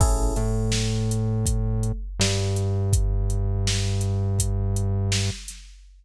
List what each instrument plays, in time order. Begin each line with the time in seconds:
0.00 synth bass 1 A1, electric piano 1 C#4 E4 G#4 A4, kick, crash
0.36 synth bass 1 A2, electric piano 1 A3, closed hi-hat
0.72 snare
1.11 closed hi-hat
1.46 kick, closed hi-hat
1.83 closed hi-hat
2.19 synth bass 1 G2, electric piano 1 G3, snare
2.56 closed hi-hat
2.93 kick, closed hi-hat
3.30 closed hi-hat
3.67 snare
4.01 closed hi-hat
4.39 kick, closed hi-hat
4.76 closed hi-hat
5.12 snare
5.48 snare, closed hi-hat